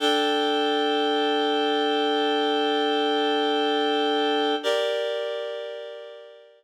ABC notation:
X:1
M:4/4
L:1/8
Q:1/4=104
K:Gm
V:1 name="Clarinet"
[DAg]8- | [DAg]8 | [GBd]8 |]